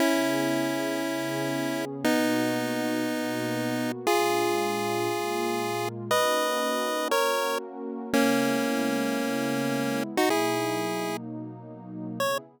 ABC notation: X:1
M:4/4
L:1/16
Q:1/4=118
K:C#dor
V:1 name="Lead 1 (square)"
[CE]16 | [B,D]16 | [^EG]16 | [Bd]8 [Ac]4 z4 |
[A,C]16 | [DF] [EG]7 z8 | c4 z12 |]
V:2 name="Pad 2 (warm)"
[C,B,EG]8 [C,B,CG]8 | [B,,A,DF]8 [B,,A,B,F]8 | [A,,G,=D^E]8 [A,,G,A,E]8 | [A,CDF]8 [A,CFA]8 |
[C,G,B,E]16 | [B,,F,A,D]16 | [C,B,EG]4 z12 |]